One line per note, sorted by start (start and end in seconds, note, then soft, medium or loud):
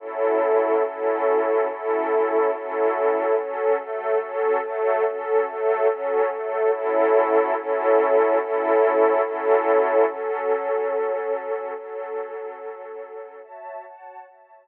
0.00 0.83 F#3 medium
0.00 0.83 C#4 medium
0.00 0.83 E4 medium
0.00 0.83 A4 medium
0.85 1.67 F#3 medium
0.85 1.67 C#4 medium
0.85 1.67 E4 medium
0.85 1.67 A4 medium
1.68 2.51 F#3 medium
1.68 2.51 C#4 medium
1.68 2.51 E4 medium
1.68 2.51 A4 medium
2.52 3.35 F#3 medium
2.52 3.35 C#4 medium
2.52 3.35 E4 medium
2.52 3.35 A4 medium
3.35 3.77 F#3 medium
3.35 3.77 C#4 medium
3.35 3.77 A4 medium
3.79 4.18 F#3 medium
3.79 4.20 A3 medium
3.79 4.18 A4 medium
4.19 4.60 F#3 medium
4.19 4.60 C#4 medium
4.19 4.60 A4 medium
4.62 5.03 F#3 medium
4.62 5.04 A3 medium
4.62 5.03 A4 medium
5.04 5.45 F#3 medium
5.04 5.46 C#4 medium
5.04 5.45 A4 medium
5.46 5.87 F#3 medium
5.46 5.87 A3 medium
5.46 5.87 A4 medium
5.88 6.28 F#3 medium
5.88 6.30 C#4 medium
5.88 6.28 A4 medium
6.29 6.71 F#3 medium
6.29 6.71 A3 medium
6.29 6.71 A4 medium
6.71 7.54 F#3 medium
6.71 7.54 C#4 medium
6.71 7.54 E4 medium
6.71 7.54 A4 medium
7.56 8.38 F#3 medium
7.56 8.38 C#4 medium
7.56 8.38 E4 medium
7.56 8.38 A4 medium
8.39 9.22 F#3 medium
8.39 9.22 C#4 medium
8.39 9.22 E4 medium
8.39 9.22 A4 medium
9.22 10.05 F#3 medium
9.22 10.05 C#4 medium
9.22 10.05 E4 medium
9.22 10.05 A4 medium
10.08 11.74 F#3 medium
10.08 11.74 C#4 medium
10.08 11.74 A4 medium
11.75 13.41 F#3 medium
11.75 13.41 C#4 medium
11.75 13.41 A4 medium
13.43 13.84 F#4 medium
13.43 13.84 C#5 medium
13.43 13.84 E5 medium
13.43 13.84 A5 medium
13.85 14.26 F#4 medium
13.85 14.26 C#5 medium
13.85 14.27 F#5 medium
13.85 14.26 A5 medium
14.26 14.67 F#4 medium
14.26 14.67 C#5 medium
14.26 14.67 E5 medium
14.26 14.67 A5 medium